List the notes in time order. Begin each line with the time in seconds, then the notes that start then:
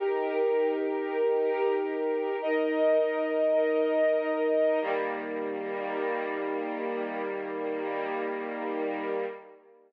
0.00 D#4 G4 A#4
2.42 D#4 A#4 D#5
4.81 D#3 G3 A#3